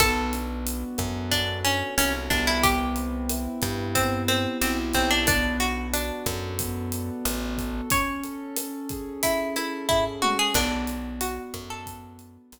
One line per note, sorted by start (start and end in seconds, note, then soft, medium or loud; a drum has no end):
0.00 0.84 B1 loud
0.00 1.31 B3 medium
0.00 1.15 A4 medium
0.00 kick loud
0.00 cross-stick loud
0.00 closed hi-hat loud
0.33 1.64 D4 medium
0.33 closed hi-hat medium
0.66 1.97 F#4 medium
0.66 closed hi-hat loud
0.98 1.83 F#2 medium
0.98 2.56 A4 medium
0.98 kick medium
0.98 cross-stick medium
0.98 closed hi-hat medium
1.31 2.30 B3 medium
1.31 1.59 D4 medium
1.31 kick medium
1.31 closed hi-hat loud
1.65 1.95 C#4 medium
1.65 2.59 D4 medium
1.65 closed hi-hat medium
1.97 2.29 C2 medium
1.97 2.13 C#4 medium
1.97 2.60 F#4 medium
1.97 cross-stick medium
1.97 closed hi-hat loud
2.30 3.48 C2 loud
2.30 3.95 B3 medium
2.30 2.46 D4 medium
2.30 kick medium
2.30 closed hi-hat medium
2.47 2.63 E4 medium
2.63 3.85 G4 medium
2.63 kick loud
2.63 closed hi-hat loud
2.96 4.28 C4 medium
2.96 closed hi-hat medium
3.30 4.61 E4 medium
3.30 cross-stick loud
3.30 closed hi-hat loud
3.62 4.47 G2 medium
3.62 4.94 G4 medium
3.62 kick medium
3.62 closed hi-hat medium
3.95 5.21 B3 medium
3.95 4.23 C4 medium
3.95 kick medium
3.95 closed hi-hat loud
4.28 5.22 C4 medium
4.28 4.58 C4 medium
4.28 cross-stick loud
4.28 closed hi-hat medium
4.61 4.93 B1 medium
4.61 4.77 C4 medium
4.61 5.24 E4 medium
4.61 closed hi-hat loud
4.94 6.11 B1 loud
4.94 5.10 C4 medium
4.94 5.26 G4 medium
4.94 kick medium
4.94 closed hi-hat medium
5.11 5.26 D4 medium
5.27 6.59 B3 medium
5.27 5.57 D4 medium
5.27 kick loud
5.27 cross-stick loud
5.27 closed hi-hat loud
5.60 6.91 D4 medium
5.60 5.87 F#4 medium
5.60 closed hi-hat medium
5.93 7.09 D4 medium
5.93 7.25 F#4 medium
5.93 closed hi-hat loud
6.26 7.11 F#2 medium
6.26 7.58 A4 medium
6.26 kick medium
6.26 cross-stick loud
6.26 closed hi-hat medium
6.59 7.84 B3 medium
6.59 kick medium
6.59 closed hi-hat loud
6.92 7.86 D4 medium
6.92 closed hi-hat medium
7.25 7.81 A1 medium
7.25 7.88 F#4 medium
7.25 cross-stick medium
7.25 closed hi-hat loud
7.58 7.90 A4 medium
7.58 kick medium
7.58 closed hi-hat medium
7.90 8.57 C#4 medium
7.90 9.04 C#5 medium
7.90 kick loud
7.90 closed hi-hat loud
8.23 9.56 A4 medium
8.23 closed hi-hat medium
8.56 9.23 C#4 medium
8.56 cross-stick loud
8.56 closed hi-hat loud
8.89 9.89 G#4 medium
8.89 kick medium
8.89 closed hi-hat medium
9.23 10.22 C#4 medium
9.23 9.55 E4 medium
9.23 kick medium
9.23 closed hi-hat loud
9.56 9.87 E4 medium
9.56 10.50 A4 medium
9.56 cross-stick medium
9.56 closed hi-hat medium
9.89 10.04 E4 medium
9.89 10.52 G#4 medium
9.89 kick loud
9.89 floor tom medium
10.22 10.53 C#4 medium
10.22 10.38 F#4 medium
10.22 high tom loud
10.39 10.55 G#4 medium
10.54 11.39 B1 medium
10.54 11.87 B3 medium
10.54 11.09 D4 medium
10.54 kick loud
10.54 cross-stick loud
10.54 crash loud
10.87 12.20 D4 medium
10.87 closed hi-hat medium
11.21 11.63 F#4 medium
11.21 12.52 F#4 medium
11.21 closed hi-hat loud
11.54 12.38 F#2 medium
11.54 12.59 A4 medium
11.54 kick medium
11.54 cross-stick medium
11.54 closed hi-hat medium
11.70 12.43 A4 medium
11.86 12.59 B3 medium
11.86 kick medium
11.86 closed hi-hat loud
12.19 12.59 D4 medium
12.19 closed hi-hat medium
12.52 12.59 B1 medium
12.52 12.59 F#4 medium
12.52 cross-stick medium
12.52 closed hi-hat loud